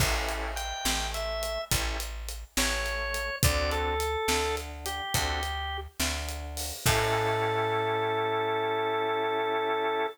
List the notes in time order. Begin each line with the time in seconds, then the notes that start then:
0.00 A1 C#4 E4 G4 A4, kick, crash
0.29 closed hi-hat
0.56 G5, closed hi-hat
0.85 A1 A3, snare
1.14 E5, closed hi-hat
1.43 closed hi-hat
1.71 A1 C#4 E4 G4 A4, kick, closed hi-hat
2.00 closed hi-hat
2.29 closed hi-hat
2.57 A1 A3 C#5, snare
2.86 closed hi-hat
3.14 closed hi-hat
3.43 D2 C4 D4 F#4 A4 D5, kick, closed hi-hat
3.71 A4, closed hi-hat
4.00 closed hi-hat
4.28 D2 D3, snare
4.57 closed hi-hat
4.86 G4, closed hi-hat
5.14 D2 C4 D4 F#4 A4, kick, closed hi-hat
5.43 closed hi-hat
6.00 D2 D3, snare
6.29 closed hi-hat
6.57 open hi-hat
6.86 A2 C#4 E4 G4 A4, kick, crash